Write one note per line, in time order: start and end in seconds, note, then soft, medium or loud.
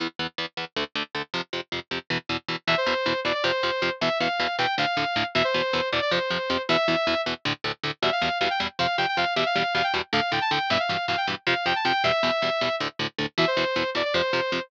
0.00 0.07 E2 medium
0.00 0.07 E3 medium
0.00 0.07 B3 medium
0.19 0.27 E2 medium
0.19 0.27 E3 medium
0.19 0.27 B3 medium
0.38 0.46 E2 medium
0.38 0.46 E3 medium
0.38 0.46 B3 medium
0.57 0.65 E2 medium
0.57 0.65 E3 medium
0.57 0.65 B3 medium
0.76 0.84 D2 medium
0.76 0.84 D3 medium
0.76 0.84 A3 medium
0.95 1.03 D2 medium
0.95 1.03 D3 medium
0.95 1.03 A3 medium
1.15 1.22 D2 medium
1.15 1.22 D3 medium
1.15 1.22 A3 medium
1.34 1.41 F2 medium
1.34 1.41 C3 medium
1.34 1.41 F3 medium
1.53 1.61 F2 medium
1.53 1.61 C3 medium
1.53 1.61 F3 medium
1.72 1.80 F2 medium
1.72 1.80 C3 medium
1.72 1.80 F3 medium
1.91 1.99 F2 medium
1.91 1.99 C3 medium
1.91 1.99 F3 medium
2.10 2.18 E2 medium
2.10 2.18 B2 medium
2.10 2.18 E3 medium
2.29 2.37 E2 medium
2.29 2.37 B2 medium
2.29 2.37 E3 medium
2.48 2.56 E2 medium
2.48 2.56 B2 medium
2.48 2.56 E3 medium
2.67 2.75 E2 medium
2.67 2.75 B2 medium
2.67 2.75 E3 medium
2.67 2.76 E5 loud
2.77 3.20 C5 loud
2.86 2.94 E2 medium
2.86 2.94 B2 medium
2.86 2.94 E3 medium
3.06 3.13 E2 medium
3.06 3.13 B2 medium
3.06 3.13 E3 medium
3.25 3.32 E2 medium
3.25 3.32 B2 medium
3.25 3.32 E3 medium
3.25 3.34 D5 loud
3.34 3.43 D5 loud
3.44 3.51 F2 medium
3.44 3.51 C3 medium
3.44 3.51 F3 medium
3.44 3.91 C5 loud
3.63 3.71 F2 medium
3.63 3.71 C3 medium
3.63 3.71 F3 medium
3.82 3.90 F2 medium
3.82 3.90 C3 medium
3.82 3.90 F3 medium
4.01 4.09 E2 medium
4.01 4.09 B2 medium
4.01 4.09 E3 medium
4.01 4.18 E5 loud
4.20 4.28 E2 medium
4.20 4.28 B2 medium
4.20 4.28 E3 medium
4.20 4.56 F5 loud
4.40 4.47 E2 medium
4.40 4.47 B2 medium
4.40 4.47 E3 medium
4.58 4.66 E2 medium
4.58 4.66 B2 medium
4.58 4.66 E3 medium
4.58 4.75 G5 loud
4.78 4.85 D2 medium
4.78 4.85 A2 medium
4.78 4.85 D3 medium
4.78 5.25 F5 loud
4.97 5.04 D2 medium
4.97 5.04 A2 medium
4.97 5.04 D3 medium
5.16 5.23 D2 medium
5.16 5.23 A2 medium
5.16 5.23 D3 medium
5.35 5.43 E2 medium
5.35 5.43 B2 medium
5.35 5.43 E3 medium
5.35 5.44 E5 loud
5.44 5.89 C5 loud
5.54 5.62 E2 medium
5.54 5.62 B2 medium
5.54 5.62 E3 medium
5.73 5.81 E2 medium
5.73 5.81 B2 medium
5.73 5.81 E3 medium
5.92 6.00 E2 medium
5.92 6.00 B2 medium
5.92 6.00 E3 medium
5.92 6.01 D5 loud
6.02 6.11 D5 loud
6.11 6.19 F2 medium
6.11 6.19 C3 medium
6.11 6.19 F3 medium
6.11 6.62 C5 loud
6.30 6.38 F2 medium
6.30 6.38 C3 medium
6.30 6.38 F3 medium
6.50 6.57 F2 medium
6.50 6.57 C3 medium
6.50 6.57 F3 medium
6.69 6.77 E2 medium
6.69 6.77 B2 medium
6.69 6.77 E3 medium
6.69 7.21 E5 loud
6.88 6.96 E2 medium
6.88 6.96 B2 medium
6.88 6.96 E3 medium
7.07 7.15 E2 medium
7.07 7.15 B2 medium
7.07 7.15 E3 medium
7.26 7.34 E2 medium
7.26 7.34 B2 medium
7.26 7.34 E3 medium
7.45 7.53 D2 medium
7.45 7.53 A2 medium
7.45 7.53 D3 medium
7.64 7.72 D2 medium
7.64 7.72 A2 medium
7.64 7.72 D3 medium
7.84 7.91 D2 medium
7.84 7.91 A2 medium
7.84 7.91 D3 medium
8.02 8.10 E2 medium
8.02 8.10 B2 medium
8.02 8.10 G3 medium
8.02 8.11 E5 loud
8.12 8.38 F5 loud
8.22 8.29 E2 medium
8.22 8.29 B2 medium
8.22 8.29 G3 medium
8.40 8.48 E2 medium
8.40 8.48 B2 medium
8.40 8.48 G3 medium
8.40 8.49 F5 loud
8.50 8.59 G5 loud
8.60 8.68 E2 medium
8.60 8.68 B2 medium
8.60 8.68 G3 medium
8.79 8.87 F2 medium
8.79 8.87 C3 medium
8.79 8.87 F3 medium
8.79 8.96 F5 loud
8.98 9.06 F2 medium
8.98 9.06 C3 medium
8.98 9.06 F3 medium
8.98 9.07 G5 loud
9.08 9.17 G5 loud
9.17 9.25 F2 medium
9.17 9.25 C3 medium
9.17 9.25 F3 medium
9.17 9.34 F5 loud
9.36 9.44 E2 medium
9.36 9.44 B2 medium
9.36 9.44 G3 medium
9.36 9.45 E5 loud
9.46 9.74 F5 loud
9.55 9.63 E2 medium
9.55 9.63 B2 medium
9.55 9.63 G3 medium
9.75 9.82 E2 medium
9.75 9.82 B2 medium
9.75 9.82 G3 medium
9.75 9.84 F5 loud
9.84 9.93 G5 loud
9.94 10.01 E2 medium
9.94 10.01 B2 medium
9.94 10.01 G3 medium
10.13 10.20 D2 medium
10.13 10.20 A2 medium
10.13 10.20 D3 medium
10.13 10.31 F5 loud
10.32 10.39 D2 medium
10.32 10.39 A2 medium
10.32 10.39 D3 medium
10.32 10.41 G5 medium
10.41 10.50 A5 loud
10.51 10.59 D2 medium
10.51 10.59 A2 medium
10.51 10.59 D3 medium
10.51 10.69 G5 loud
10.70 10.78 G2 medium
10.70 10.78 B2 medium
10.70 10.78 E3 medium
10.70 10.79 E5 loud
10.80 11.06 F5 loud
10.89 10.97 G2 medium
10.89 10.97 B2 medium
10.89 10.97 E3 medium
11.08 11.16 G2 medium
11.08 11.16 B2 medium
11.08 11.16 E3 medium
11.08 11.17 F5 loud
11.17 11.26 G5 loud
11.27 11.35 G2 medium
11.27 11.35 B2 medium
11.27 11.35 E3 medium
11.47 11.54 F2 medium
11.47 11.54 C3 medium
11.47 11.54 F3 medium
11.47 11.66 F5 medium
11.66 11.73 F2 medium
11.66 11.73 C3 medium
11.66 11.73 F3 medium
11.66 11.75 G5 loud
11.76 11.85 A5 medium
11.85 11.92 F2 medium
11.85 11.92 C3 medium
11.85 11.92 F3 medium
11.85 12.03 G5 loud
12.04 12.12 E2 medium
12.04 12.12 B2 medium
12.04 12.12 G3 medium
12.04 12.75 E5 loud
12.23 12.31 E2 medium
12.23 12.31 B2 medium
12.23 12.31 G3 medium
12.42 12.50 E2 medium
12.42 12.50 B2 medium
12.42 12.50 G3 medium
12.61 12.69 E2 medium
12.61 12.69 B2 medium
12.61 12.69 G3 medium
12.80 12.88 D2 medium
12.80 12.88 A2 medium
12.80 12.88 D3 medium
12.99 13.07 D2 medium
12.99 13.07 A2 medium
12.99 13.07 D3 medium
13.18 13.26 D2 medium
13.18 13.26 A2 medium
13.18 13.26 D3 medium
13.38 13.45 E2 medium
13.38 13.45 B2 medium
13.38 13.45 E3 medium
13.38 13.47 E5 loud
13.47 13.90 C5 loud
13.57 13.64 E2 medium
13.57 13.64 B2 medium
13.57 13.64 E3 medium
13.76 13.83 E2 medium
13.76 13.83 B2 medium
13.76 13.83 E3 medium
13.95 14.02 E2 medium
13.95 14.02 B2 medium
13.95 14.02 E3 medium
13.95 14.04 D5 loud
14.05 14.14 D5 loud
14.14 14.22 F2 medium
14.14 14.22 C3 medium
14.14 14.22 F3 medium
14.14 14.61 C5 loud
14.33 14.41 F2 medium
14.33 14.41 C3 medium
14.33 14.41 F3 medium
14.52 14.60 F2 medium
14.52 14.60 C3 medium
14.52 14.60 F3 medium